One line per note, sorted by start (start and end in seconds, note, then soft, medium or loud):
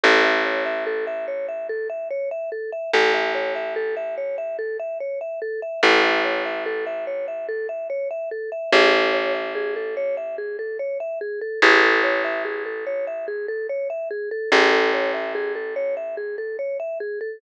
0.03 2.70 A1 medium
0.03 0.22 A4 medium
0.24 0.43 E5 medium
0.45 0.64 C#5 medium
0.66 0.84 E5 medium
0.86 1.05 A4 medium
1.07 1.26 E5 medium
1.28 1.46 C#5 medium
1.48 1.67 E5 medium
1.69 1.88 A4 medium
1.90 2.08 E5 medium
2.11 2.29 C#5 medium
2.31 2.50 E5 medium
2.52 2.71 A4 medium
2.72 2.91 E5 medium
2.93 5.60 A1 medium
2.93 3.12 A4 medium
3.14 3.32 E5 medium
3.35 3.53 C#5 medium
3.55 3.74 E5 medium
3.76 3.95 A4 medium
3.97 4.15 E5 medium
4.17 4.36 C#5 medium
4.38 4.57 E5 medium
4.59 4.77 A4 medium
4.79 4.98 E5 medium
5.00 5.19 C#5 medium
5.21 5.40 E5 medium
5.42 5.60 A4 medium
5.62 5.81 E5 medium
5.83 8.49 A1 medium
5.83 6.02 A4 medium
6.04 6.22 E5 medium
6.24 6.43 C#5 medium
6.45 6.64 E5 medium
6.66 6.84 A4 medium
6.86 7.05 E5 medium
7.07 7.26 C#5 medium
7.28 7.46 E5 medium
7.49 7.67 A4 medium
7.69 7.88 E5 medium
7.90 8.08 C#5 medium
8.11 8.29 E5 medium
8.31 8.50 A4 medium
8.52 8.71 E5 medium
8.72 11.39 A1 medium
8.72 8.91 G#4 loud
8.93 9.12 A4 medium
9.14 9.32 C#5 medium
9.34 9.53 E5 medium
9.55 9.74 G#4 medium
9.76 9.95 A4 medium
9.97 10.15 C#5 medium
10.17 10.36 E5 medium
10.38 10.57 G#4 medium
10.59 10.77 A4 medium
10.79 10.98 C#5 medium
11.00 11.19 E5 medium
11.21 11.40 G#4 medium
11.41 11.60 A4 medium
11.62 14.29 A1 medium
11.62 11.81 G#4 loud
11.83 12.01 A4 medium
12.04 12.22 C#5 medium
12.24 12.43 E5 medium
12.45 12.64 G#4 medium
12.66 12.84 A4 medium
12.87 13.05 C#5 medium
13.07 13.26 E5 medium
13.28 13.46 G#4 medium
13.48 13.67 A4 medium
13.69 13.88 C#5 medium
13.90 14.09 E5 medium
14.11 14.29 G#4 medium
14.31 14.50 A4 medium
14.52 17.18 A1 medium
14.52 14.71 G#4 loud
14.72 14.91 A4 medium
14.93 15.12 C#5 medium
15.14 15.33 E5 medium
15.35 15.53 G#4 medium
15.55 15.74 A4 medium
15.76 15.95 C#5 medium
15.97 16.15 E5 medium
16.17 16.36 G#4 medium
16.38 16.57 A4 medium
16.59 16.77 C#5 medium
16.80 16.98 E5 medium
17.00 17.19 G#4 medium
17.21 17.39 A4 medium